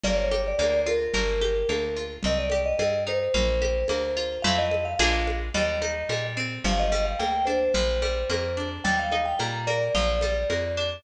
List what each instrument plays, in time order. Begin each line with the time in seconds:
0.04 electric bass (finger) G1, acoustic guitar (steel) A#3, vibraphone D5, low conga
0.17 vibraphone C#5
0.31 acoustic guitar (steel) G4, high conga
0.47 vibraphone D5
0.58 electric bass (finger) D2, acoustic guitar (steel) A#3, vibraphone D5, high conga
0.86 acoustic guitar (steel) F4, vibraphone A#4, high conga
1.14 electric bass (finger) G1, acoustic guitar (steel) A#3, low conga
1.41 acoustic guitar (steel) G4, high conga
1.69 electric bass (finger) D2, acoustic guitar (steel) A#3, high conga
1.97 acoustic guitar (steel) F4
2.23 electric bass (finger) C2, acoustic guitar (steel) C4, vibraphone D#5, low conga
2.38 vibraphone D5
2.50 acoustic guitar (steel) G4, high conga
2.65 vibraphone D#5
2.79 electric bass (finger) G2, acoustic guitar (steel) C4, vibraphone D#5, high conga
3.07 acoustic guitar (steel) D#4, vibraphone C5, high conga
3.34 electric bass (finger) A#1, acoustic guitar (steel) A#3, low conga
3.62 acoustic guitar (steel) G4, high conga
3.88 electric bass (finger) D2, acoustic guitar (steel) A#3, high conga
4.17 acoustic guitar (steel) F4
4.42 electric bass (finger) F2, acoustic guitar (steel) A3 C4 E4 F4, vibraphone F5, low conga
4.58 vibraphone D#5
4.71 high conga
4.85 vibraphone F5
4.99 electric bass (finger) A#1, acoustic guitar (steel) G#3 A#3 D4 F4, vibraphone F5, high conga
5.27 high conga
5.54 electric bass (finger) D#2, acoustic guitar (steel) G3, vibraphone D#5, low conga
5.82 acoustic guitar (steel) D#4, high conga
6.09 electric bass (finger) A#2, acoustic guitar (steel) G3, high conga
6.37 acoustic guitar (steel) C4
6.64 electric bass (finger) G1, acoustic guitar (steel) F3, vibraphone F5, low conga
6.79 vibraphone D#5
6.92 acoustic guitar (steel) G3, high conga
7.05 vibraphone F5
7.19 electric bass (finger) D2, acoustic guitar (steel) A#3, vibraphone G5, high conga
7.45 acoustic guitar (steel) D4, vibraphone C5, high conga
7.74 electric bass (finger) A#1, acoustic guitar (steel) F3, low conga
8.02 acoustic guitar (steel) G3, high conga
8.30 electric bass (finger) F2, acoustic guitar (steel) A#3, high conga
8.57 acoustic guitar (steel) D4
8.84 electric bass (finger) D#2, acoustic guitar (steel) G3, vibraphone G5, low conga
8.99 vibraphone F5
9.12 acoustic guitar (steel) D#4, high conga
9.25 vibraphone G5
9.39 electric bass (finger) A#2, acoustic guitar (steel) G3, vibraphone A#5, high conga
9.67 acoustic guitar (steel) A#3, vibraphone D5, high conga
9.95 electric bass (finger) A#1, acoustic guitar (steel) F3, low conga
10.21 acoustic guitar (steel) G3, high conga
10.50 electric bass (finger) F2, acoustic guitar (steel) A#3, high conga
10.77 acoustic guitar (steel) D4